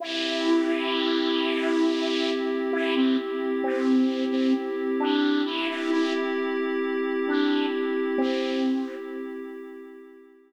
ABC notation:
X:1
M:3/4
L:1/16
Q:1/4=66
K:Cmix
V:1 name="Flute"
E12 | E C z2 C3 C z2 D2 | E E E z5 D2 z2 | C4 z8 |]
V:2 name="Pad 5 (bowed)"
[CEG]12- | [CEG]12 | [CEG]12- | [CEG]12 |]